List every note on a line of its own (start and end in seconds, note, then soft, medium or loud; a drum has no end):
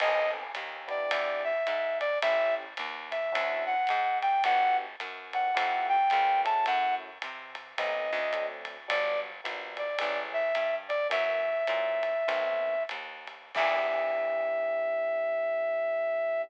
0.00 0.52 B1 loud
0.00 0.43 B3 medium
0.00 0.43 C4 medium
0.00 0.43 D#4 medium
0.00 0.43 A4 medium
0.00 0.31 D#5 loud
0.00 crash medium
0.00 ride medium
0.55 1.07 D#2 medium
0.55 hi-hat pedal medium
0.55 ride medium
0.88 1.52 B3 medium
0.88 1.52 D4 medium
0.88 1.52 E4 medium
0.88 1.52 G4 medium
0.88 1.43 D5 medium
0.88 ride medium
1.11 1.63 E2 medium
1.11 ride loud
1.44 1.98 E5 medium
1.67 2.19 G#2 medium
1.67 hi-hat pedal medium
1.67 ride medium
2.00 2.19 D5 loud
2.00 ride medium
2.22 2.74 A1 medium
2.22 2.65 A3 medium
2.22 2.65 C#4 medium
2.22 2.65 E4 medium
2.22 2.65 G4 medium
2.22 2.55 E5 loud
2.22 kick medium
2.22 ride loud
2.77 3.30 D#2 medium
2.77 hi-hat pedal medium
2.77 ride medium
3.11 3.64 E5 medium
3.11 ride medium
3.32 3.86 D2 loud
3.32 3.74 C#4 medium
3.32 3.74 D4 medium
3.32 3.74 E4 medium
3.32 3.74 F#4 medium
3.32 kick medium
3.32 ride loud
3.66 4.18 F#5 medium
3.87 4.41 G#2 loud
3.87 hi-hat pedal medium
3.87 ride medium
4.22 4.43 G5 loud
4.22 ride medium
4.44 4.96 G1 medium
4.44 4.86 B3 medium
4.44 4.86 D4 medium
4.44 4.86 F#4 medium
4.44 4.86 G4 medium
4.44 4.77 F#5 loud
4.44 ride loud
5.00 5.52 F#2 medium
5.00 hi-hat pedal medium
5.00 ride medium
5.33 5.50 B3 medium
5.33 5.50 D4 medium
5.33 5.50 F#4 medium
5.33 5.50 G4 medium
5.33 5.87 F#5 medium
5.33 ride medium
5.54 6.09 F2 loud
5.54 5.97 A3 medium
5.54 5.97 E4 medium
5.54 5.97 F4 medium
5.54 5.97 G4 medium
5.54 ride loud
5.89 6.41 G5 loud
6.10 6.64 C#2 loud
6.10 6.45 A#3 medium
6.10 6.45 B3 medium
6.10 6.44 C#4 medium
6.10 6.45 F4 medium
6.10 kick medium
6.10 hi-hat pedal medium
6.10 ride medium
6.45 7.09 A3 medium
6.45 7.09 C#4 medium
6.45 7.09 E4 medium
6.45 7.09 F#4 medium
6.45 6.65 A5 loud
6.45 ride medium
6.66 7.18 F#2 loud
6.66 6.95 F#5 loud
6.66 ride medium
7.22 7.75 C3 medium
7.22 hi-hat pedal medium
7.22 ride medium
7.55 ride medium
7.77 8.11 B1 medium
7.77 8.21 A3 medium
7.77 8.21 B3 medium
7.77 8.21 C4 medium
7.77 8.21 D#4 medium
7.77 8.46 D#5 medium
7.77 kick medium
7.77 ride loud
8.13 8.87 D2 loud
8.32 8.77 F#3 medium
8.32 8.77 A3 loud
8.32 8.77 C4 medium
8.32 8.77 D4 medium
8.32 kick medium
8.32 hi-hat pedal medium
8.32 ride medium
8.65 ride medium
8.88 9.41 G1 medium
8.88 9.30 F#3 medium
8.88 9.30 G3 medium
8.88 9.30 B3 medium
8.88 9.30 D4 medium
8.88 9.20 D5 loud
8.88 ride loud
9.44 9.96 A#1 medium
9.44 9.86 F#3 medium
9.44 9.86 G3 medium
9.44 9.86 B3 medium
9.44 9.86 D4 medium
9.44 hi-hat pedal medium
9.44 ride medium
9.77 10.20 D5 medium
9.77 ride medium
9.98 10.52 A1 loud
9.98 10.42 E3 medium
9.98 10.42 G#3 medium
9.98 10.42 A3 medium
9.98 10.42 C#4 medium
9.98 ride loud
10.33 10.76 E5 loud
10.55 11.07 G2 medium
10.55 hi-hat pedal medium
10.55 ride medium
10.89 11.07 D5 loud
10.89 ride medium
11.09 11.64 F#2 loud
11.09 11.52 E3 medium
11.09 11.52 F#3 medium
11.09 11.52 A#3 medium
11.09 11.52 C#4 medium
11.09 12.83 E5 loud
11.09 ride loud
11.67 12.24 A#2 medium
11.67 12.13 E3 medium
11.67 12.13 F#3 medium
11.67 12.13 A#3 medium
11.67 12.13 C#4 medium
11.67 hi-hat pedal medium
11.67 ride medium
12.03 ride medium
12.28 12.86 B1 medium
12.28 12.75 D#3 medium
12.28 12.75 A3 medium
12.28 12.75 B3 medium
12.28 12.75 C4 medium
12.28 ride medium
12.89 13.51 D#2 medium
12.89 hi-hat pedal medium
12.89 ride medium
13.27 ride medium
13.55 16.44 E2 loud
13.55 16.44 B3 loud
13.55 16.44 D4 medium
13.55 16.44 E4 medium
13.55 16.44 G4 loud
13.55 16.42 E5 loud
13.55 kick loud
13.55 crash loud